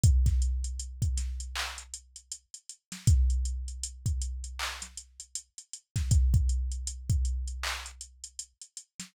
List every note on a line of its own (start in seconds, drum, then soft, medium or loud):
0.03 kick loud
0.03 closed hi-hat loud
0.26 kick medium
0.26 snare soft
0.26 closed hi-hat medium
0.42 closed hi-hat medium
0.64 closed hi-hat medium
0.79 closed hi-hat loud
1.02 kick medium
1.02 closed hi-hat medium
1.17 snare soft
1.17 closed hi-hat loud
1.40 closed hi-hat medium
1.56 clap loud
1.78 closed hi-hat medium
1.94 closed hi-hat loud
2.16 closed hi-hat medium
2.31 closed hi-hat loud
2.54 closed hi-hat medium
2.69 closed hi-hat medium
2.92 snare medium
2.92 closed hi-hat medium
3.07 kick loud
3.07 closed hi-hat loud
3.30 closed hi-hat medium
3.45 closed hi-hat medium
3.68 closed hi-hat medium
3.83 closed hi-hat loud
4.06 kick medium
4.06 closed hi-hat medium
4.22 closed hi-hat loud
4.44 closed hi-hat medium
4.59 clap loud
4.82 snare soft
4.82 closed hi-hat loud
4.97 closed hi-hat medium
5.20 closed hi-hat medium
5.35 closed hi-hat loud
5.58 closed hi-hat medium
5.73 closed hi-hat medium
5.96 kick medium
5.96 snare medium
5.96 closed hi-hat medium
6.11 kick loud
6.11 closed hi-hat loud
6.34 kick loud
6.34 closed hi-hat medium
6.49 closed hi-hat medium
6.72 closed hi-hat medium
6.87 closed hi-hat loud
7.09 kick loud
7.09 closed hi-hat medium
7.25 closed hi-hat medium
7.47 closed hi-hat medium
7.63 clap loud
7.86 closed hi-hat medium
8.01 closed hi-hat medium
8.24 closed hi-hat medium
8.39 closed hi-hat loud
8.61 closed hi-hat medium
8.77 closed hi-hat medium
9.00 snare medium
9.00 closed hi-hat medium